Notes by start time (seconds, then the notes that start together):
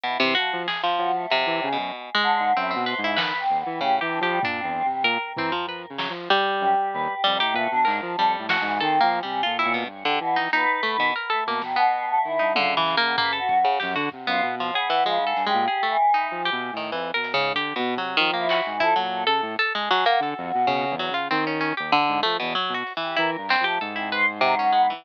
0.04 B2 E4
0.20 C3 E3 C5
0.35 F3 F#4
0.52 F3
0.68 G#4, snare
0.83 F3
0.98 F3 F#4, cowbell
1.15 A3
1.30 F2 C3, closed hi-hat
1.46 E3
1.62 C#3 G#3, cowbell
1.72 B2
1.77 F#2
2.15 G#3
2.23 D3
2.40 G#2
2.56 F#2 C4 E4
2.71 C4
2.75 B2
2.86 B4 C5, closed hi-hat
2.98 G#2
3.03 C#3 E4
3.17 D#3 B4, snare
3.39 C4
3.49 D#2
3.60 B3
3.65 E3
3.80 A2 C#3 G4, kick
3.96 C3
4.01 E3 G4
4.11 D4
4.20 F3 G4
4.28 G3
4.42 A#2 G3 D4, floor tom
4.58 C4
4.64 E2
4.85 C3 G3
5.04 A#2 A#4
5.36 E3 C4, floor tom
5.52 F3
5.67 F3 B4
5.89 C#3
5.98 F#3, snare
6.09 F3
6.30 G3
6.60 F#2 G4
6.93 D#2 B4
7.13 G4
7.24 F2 G3
7.35 D#3
7.40 A2 G4
7.53 A#2 A3 B4, kick
7.71 B2 D4
7.85 G#2 A#4, clap
8.02 F3
8.17 F2 G3 A4
8.39 A2
8.49 C#4 F#4, snare
8.61 G#2 E3
8.80 D#3 C4 A4
9.01 F3 A#3
9.12 C#4, closed hi-hat
9.23 C3 G3
9.43 A#2 F4 A4
9.58 E4 C#5
9.65 A#2
9.74 B2
9.85 G2
10.05 D3 G4
10.20 B2 E3
10.36 D#4, snare
10.52 A#2 D#4 B4
10.83 A3
10.97 B2 D#3
11.16 A#4
11.30 A3 A4
11.46 B2 A#3
11.62 B2 D#3, snare
11.76 B2 B3
12.08 A3
12.23 D#3 E4
12.39 G2 D#4
12.55 C#3 D3 F4, high tom
12.77 E3
12.87 clap
12.97 A#3
13.03 B2
13.18 A#3 B4, floor tom
13.33 A4
13.39 F#4
13.49 F#2, kick
13.59 F#4
13.64 C#3
13.80 F#2 G4, snare
13.95 D3 F#4
14.12 C3, kick
14.26 F#2 B3 F4
14.42 B2
14.60 F3
14.74 B3 G#4, cowbell
14.90 E3
15.04 C#3 F3 G#3
15.19 G#2
15.27 A4
15.36 G2, closed hi-hat
15.46 G#3 G4
15.54 A#2
15.68 G#4
15.83 A3
15.89 E3
16.14 D#4
16.31 F3
16.45 G4
16.52 B2
16.73 A2
16.77 D#3
16.92 F2 E3, kick
17.14 B2 A#4
17.24 closed hi-hat
17.34 G#2 C#3
17.54 D3 G4, kick
17.76 B2
17.96 C3 F#3
18.17 D#3 F3
18.34 A#3
18.39 E4
18.49 F#4, clap
18.61 E3
18.66 G#2
18.80 F3 E4 A4, kick
18.96 A#2 F#3
19.02 A4
19.22 A4
19.27 C#3 A4
19.42 A2
19.59 A4
19.74 G#3 G#4
19.91 F#3
20.05 A#3 F#4, closed hi-hat
20.20 D3 A4
20.38 F2
20.54 B2
20.66 B2 C#3, kick
20.90 E2
20.99 F#3
21.10 C#3
21.14 F4
21.31 D#3 C4
21.47 C#4
21.61 C#4
21.77 D#2 G4
21.92 D3, floor tom
22.09 G#2
22.23 F3 A3
22.40 E2 B2
22.55 F#3
22.69 B2
22.74 F#4
22.87 closed hi-hat
22.97 E3
23.02 G4
23.16 E3 E4 A#4
23.37 G2
23.49 G3 C4, clap
23.60 F3
23.64 A3 G4
23.80 G#2 A4
23.95 C4 E4
24.12 B4 C5
24.41 C3 F#3
24.59 C#4
24.72 G#3 B3, floor tom
24.90 E3